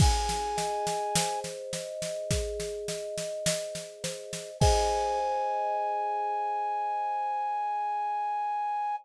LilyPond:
<<
  \new Staff \with { instrumentName = "Flute" } { \time 4/4 \key aes \mixolydian \tempo 4 = 52 aes''4. r2 r8 | aes''1 | }
  \new Staff \with { instrumentName = "Kalimba" } { \time 4/4 \key aes \mixolydian aes'8 ees''8 c''8 ees''8 aes'8 ees''8 ees''8 c''8 | <aes' c'' ees''>1 | }
  \new DrumStaff \with { instrumentName = "Drums" } \drummode { \time 4/4 <cymc bd sn>16 sn16 sn16 sn16 sn16 sn16 sn16 sn16 <bd sn>16 sn16 sn16 sn16 sn16 sn16 sn16 sn16 | <cymc bd>4 r4 r4 r4 | }
>>